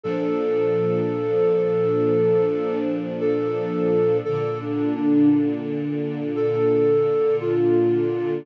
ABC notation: X:1
M:4/4
L:1/8
Q:1/4=57
K:Fmix
V:1 name="Flute"
A6 A2 | (3A D D z2 A2 F2 |]
V:2 name="String Ensemble 1"
[B,,F,D]8 | [B,,D,D]8 |]